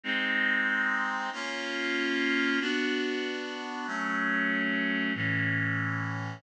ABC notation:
X:1
M:3/4
L:1/8
Q:1/4=141
K:Bbm
V:1 name="Clarinet"
[A,CE]6 | [B,DF]6 | [K:Bm] [B,DF]6 | [F,A,C]6 |
[A,,E,C]6 |]